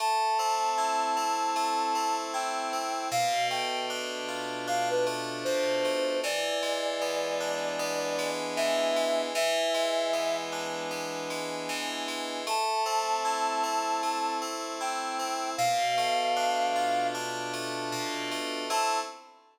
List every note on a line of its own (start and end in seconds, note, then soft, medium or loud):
0.00 1.55 A3 loud
0.00 2.16 A5 medium
0.39 1.16 C4 loud
0.78 2.33 E4 medium
1.17 1.94 C4 medium
1.56 3.05 A3 loud
1.95 2.72 C4 medium
2.33 3.08 E4 medium
2.33 3.08 G5 medium
2.73 3.10 C4 medium
3.11 5.45 B2 loud
3.11 3.48 F5 loud
3.50 5.06 A3 medium
3.50 3.86 G5 loud
3.90 4.67 D4 loud
4.28 6.15 F4 medium
4.67 6.17 D4 loud
4.67 4.89 F5 medium
4.90 5.06 B4 medium
5.06 5.84 A3 medium
5.44 6.20 B2 medium
5.44 6.19 C5 medium
5.84 6.22 A3 medium
6.24 8.56 E3 loud
6.24 8.29 D5 loud
6.62 8.18 G#3 medium
7.01 7.79 B3 medium
7.40 9.27 D4 medium
7.79 9.28 B3 loud
8.19 8.96 G#3 loud
8.56 9.32 E3 loud
8.56 9.21 E5 loud
8.96 9.33 G#3 medium
9.35 11.68 E3 loud
9.35 10.36 E5 loud
9.74 11.30 G#3 medium
10.13 10.90 B3 medium
10.52 12.39 D4 medium
10.91 12.40 B3 medium
11.30 12.07 G#3 medium
11.69 12.44 E3 loud
12.08 12.45 G#3 medium
12.47 14.02 A3 loud
12.47 14.37 A5 medium
12.86 13.63 C4 loud
13.25 14.80 E4 medium
13.63 14.41 C4 medium
14.03 15.52 A3 medium
14.42 15.19 C4 medium
14.81 15.55 E4 medium
14.81 15.50 G5 medium
15.19 15.56 C4 medium
15.57 17.92 B2 loud
15.57 17.07 F5 loud
15.98 17.53 A3 medium
16.36 17.14 D4 loud
16.75 18.62 F4 medium
17.14 18.64 D4 loud
17.53 18.31 A3 loud
17.92 18.67 B2 medium
18.31 18.69 A3 loud
18.70 18.99 A3 loud
18.70 18.99 C4 loud
18.70 18.99 E4 medium
18.70 19.00 A5 loud